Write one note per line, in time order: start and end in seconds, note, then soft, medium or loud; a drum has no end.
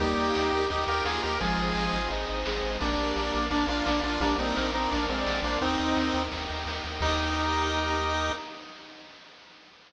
0.00 0.14 D#2 medium
0.00 0.61 G3 loud
0.00 1.38 A#3 medium
0.00 0.61 A#3 loud
0.00 0.66 D#4 medium
0.00 1.38 D#4 medium
0.00 0.66 G4 medium
0.00 1.38 G4 medium
0.00 0.52 G4 loud
0.00 kick loud
0.00 ride medium
0.17 0.32 D#2 medium
0.17 0.70 A#4 medium
0.17 ride medium
0.35 0.51 D#2 medium
0.35 0.88 D#5 medium
0.35 snare loud
0.53 0.68 D#2 medium
0.53 1.06 G4 medium
0.53 ride medium
0.70 0.85 D#2 medium
0.70 0.84 D#4 medium
0.70 0.85 D#4 loud
0.70 0.84 G4 medium
0.70 1.23 A#4 medium
0.70 kick medium
0.70 ride medium
0.87 1.02 D#2 medium
0.87 1.05 F4 loud
0.87 1.04 G4 medium
0.87 1.04 A#4 medium
0.87 1.38 D#5 medium
0.87 ride medium
1.05 1.20 D#2 medium
1.05 1.35 A#3 loud
1.05 1.21 F4 medium
1.05 1.40 G4 medium
1.05 1.21 G#4 medium
1.05 snare loud
1.23 1.39 D#2 medium
1.23 1.38 G4 medium
1.23 1.38 A#4 medium
1.23 1.40 A#4 medium
1.23 snare medium
1.23 ride medium
1.40 1.56 G#1 medium
1.40 1.97 F3 loud
1.40 1.97 G#3 loud
1.40 2.79 C4 medium
1.40 2.79 D#4 medium
1.40 2.08 F4 medium
1.40 1.92 G#4 loud
1.40 2.79 G#4 medium
1.40 2.08 G#4 medium
1.40 kick medium
1.40 ride loud
1.58 1.73 G#1 medium
1.58 2.10 C5 medium
1.58 ride medium
1.75 1.89 G#1 medium
1.75 2.27 D#5 medium
1.75 snare medium
1.92 2.08 G#1 medium
1.92 2.45 G#4 medium
1.92 ride medium
2.10 2.25 G#1 medium
2.10 2.27 D#4 loud
2.10 2.61 C5 medium
2.10 kick medium
2.10 ride medium
2.27 2.44 G#1 medium
2.27 2.42 D#4 loud
2.27 2.77 D#5 medium
2.27 ride medium
2.45 2.62 G#1 medium
2.45 2.77 G#3 loud
2.45 2.79 G#4 medium
2.45 snare loud
2.62 2.78 G#1 medium
2.62 2.79 C5 medium
2.62 snare medium
2.62 ride medium
2.80 2.96 A#1 medium
2.80 3.37 G3 loud
2.80 4.19 A#3 medium
2.80 3.37 A#3 loud
2.80 3.46 A#3 medium
2.80 4.19 D4 medium
2.80 3.46 D4 medium
2.80 4.19 F4 medium
2.80 3.33 A#4 medium
2.80 kick loud
2.80 ride loud
2.98 3.13 A#1 medium
2.98 3.50 D5 medium
2.98 ride medium
3.16 3.31 A#1 medium
3.16 3.68 F5 medium
3.16 snare medium
3.33 3.49 A#1 medium
3.33 3.84 A#4 medium
3.33 ride medium
3.51 3.65 A#1 medium
3.51 3.66 A#3 medium
3.51 3.65 D4 loud
3.51 3.66 D4 medium
3.51 4.04 D5 medium
3.51 kick medium
3.51 ride loud
3.67 3.82 A#1 medium
3.67 3.85 D4 medium
3.67 3.83 F4 loud
3.67 3.85 F4 medium
3.67 4.18 F5 medium
3.67 ride medium
3.85 4.01 A#1 medium
3.85 4.00 A#3 medium
3.85 4.18 A#3 loud
3.85 4.00 D4 medium
3.85 4.18 A#4 medium
3.85 snare loud
4.03 4.18 A#1 medium
4.03 4.20 D4 medium
4.03 4.20 F4 medium
4.03 4.21 D5 medium
4.03 snare medium
4.03 ride medium
4.20 4.35 A#1 medium
4.20 4.55 G3 loud
4.20 5.60 A#3 medium
4.20 4.55 A#3 loud
4.20 4.35 A#3 medium
4.20 5.60 D4 medium
4.20 4.35 D4 medium
4.20 5.60 F4 medium
4.20 4.74 A#4 loud
4.20 kick loud
4.20 ride loud
4.38 4.53 A#1 medium
4.38 4.71 C4 medium
4.38 4.71 D#4 medium
4.38 4.92 D5 medium
4.38 ride medium
4.56 4.72 A#1 medium
4.56 4.71 A#4 loud
4.56 5.09 F5 medium
4.56 snare loud
4.73 4.88 A#1 medium
4.73 4.90 C4 medium
4.73 4.90 D#4 medium
4.73 5.15 A#4 loud
4.73 5.26 A#4 medium
4.73 ride medium
4.91 5.07 A#1 medium
4.91 5.05 A#3 medium
4.91 5.05 D4 medium
4.91 5.44 D5 medium
4.91 kick medium
4.91 ride loud
5.09 5.24 A#1 medium
5.09 5.41 G#3 medium
5.09 5.41 C4 medium
5.09 5.60 F5 medium
5.09 ride medium
5.18 5.41 D5 loud
5.26 5.41 A#1 medium
5.26 5.60 A#4 medium
5.26 snare loud
5.42 5.57 A#1 medium
5.42 5.58 A#3 medium
5.42 5.58 D4 medium
5.42 5.60 C5 loud
5.42 5.61 D5 medium
5.42 snare medium
5.42 ride medium
5.61 5.77 D#2 medium
5.61 7.00 A#3 medium
5.61 6.23 C4 medium
5.61 6.20 C4 loud
5.61 7.00 D#4 medium
5.61 6.23 D#4 medium
5.61 6.20 D#4 loud
5.61 7.00 G4 medium
5.61 6.14 A#4 loud
5.61 kick medium
5.61 ride medium
5.79 5.95 D#2 medium
5.79 6.31 D#5 medium
5.79 ride medium
5.96 6.12 D#2 medium
5.96 6.48 G5 medium
5.96 snare loud
6.14 6.29 D#2 medium
6.14 6.67 A#4 medium
6.14 ride medium
6.31 6.47 D#2 medium
6.31 6.84 D#5 medium
6.31 kick medium
6.31 ride loud
6.49 6.65 D#2 medium
6.49 6.99 G5 medium
6.49 ride medium
6.66 6.81 D#2 medium
6.66 7.00 A#4 medium
6.66 snare loud
6.84 6.99 D#2 medium
6.84 7.01 D#5 medium
6.84 snare soft
6.84 ride medium
7.01 8.31 D#2 loud
7.01 8.32 A#3 loud
7.01 8.32 D#4 loud
7.01 8.32 G4 loud
7.01 8.32 A#4 loud
7.01 8.32 D#5 loud
7.01 kick loud
7.01 crash loud